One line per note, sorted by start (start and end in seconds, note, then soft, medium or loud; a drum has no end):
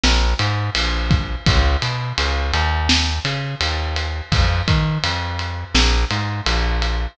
0.04 0.34 A#1 medium
0.04 snare loud
0.39 0.70 G#2 medium
0.39 ride medium
0.75 1.36 A#1 medium
0.75 ride loud
1.11 kick loud
1.11 ride medium
1.46 1.77 C#2 medium
1.46 kick loud
1.46 ride loud
1.82 2.13 B2 medium
1.82 ride medium
2.18 2.52 C#2 medium
2.18 ride loud
2.54 3.20 D#2 medium
2.54 ride medium
2.89 snare loud
3.25 3.55 C#3 medium
3.25 ride medium
3.61 4.21 D#2 medium
3.61 ride loud
3.96 ride medium
4.32 4.62 F2 medium
4.32 kick loud
4.32 ride loud
4.68 4.99 D#3 medium
4.68 kick medium
4.68 ride medium
5.04 5.64 F2 medium
5.04 ride loud
5.39 ride medium
5.75 6.05 A#1 medium
5.75 snare loud
6.11 6.41 G#2 medium
6.11 ride medium
6.46 7.07 A#1 medium
6.46 ride loud
6.82 ride medium